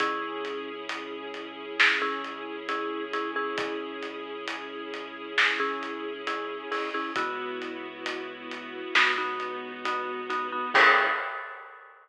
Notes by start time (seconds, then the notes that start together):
0.00 C#2 C#4 E4 G#4, kick, closed hi-hat
0.45 closed hi-hat
0.89 closed hi-hat
1.34 closed hi-hat
1.80 snare
2.02 C#4 E4 G#4
2.24 closed hi-hat
2.69 C#4 E4 G#4, closed hi-hat
3.13 C#4 E4 G#4, closed hi-hat
3.36 C#4 E4 G#4
3.58 kick, closed hi-hat
4.03 closed hi-hat
4.48 closed hi-hat
4.94 closed hi-hat
5.38 snare
5.60 C#4 E4 G#4
5.83 closed hi-hat
6.27 C#4 E4 G#4, closed hi-hat
6.72 C#4 E4 G#4, open hi-hat
6.94 C#4 E4 G#4
7.16 C#2 B3 E4 F#4, kick, closed hi-hat
7.62 closed hi-hat
8.06 closed hi-hat
8.51 closed hi-hat
8.95 C#2 B3 D#4 F#4, snare
9.18 B3 D#4 F#4
9.40 closed hi-hat
9.85 B3 D#4 F#4, closed hi-hat
10.30 B3 D#4 F#4, closed hi-hat
10.52 B3 D#4 F#4
10.74 C#2 C#4 E4 G#4, kick, crash